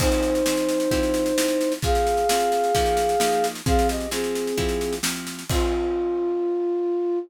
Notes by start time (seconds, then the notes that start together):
0.00 F3 C4 D#4 G#4 C5, kick, snare, crash
0.12 snare
0.23 snare
0.35 snare
0.46 F3 C4 G#4, snare
0.57 snare
0.69 snare
0.80 snare
0.91 F3 C4 E4 G4, kick, snare
1.03 snare
1.14 snare
1.26 snare
1.38 F3 C4 E4 G4, snare
1.48 snare
1.61 snare
1.72 snare
1.82 F3 C4 G#4 F5, kick, snare
1.95 snare
2.07 snare
2.17 snare
2.29 F3 C4 G#4, snare
2.40 snare
2.52 snare
2.64 snare
2.75 F3 A#3 D#4 G4, kick, snare
2.86 snare
2.97 snare
3.09 snare
3.20 F3 A#3 D#4 G4, snare
3.32 snare
3.44 snare
3.55 snare
3.66 F3 C4 G#4 F5, kick, snare
3.79 snare
3.89 G4 D#5, snare
4.00 snare
4.11 F3 C4 G#4, snare
4.24 snare
4.35 snare
4.47 snare
4.57 F3 C4 E4 G4, kick, snare
4.69 snare
4.81 snare
4.93 snare
5.03 F3 C4 E4 G4, snare
5.16 snare
5.27 snare
5.39 snare
5.49 F3 C4 F4 G#4, kick, crash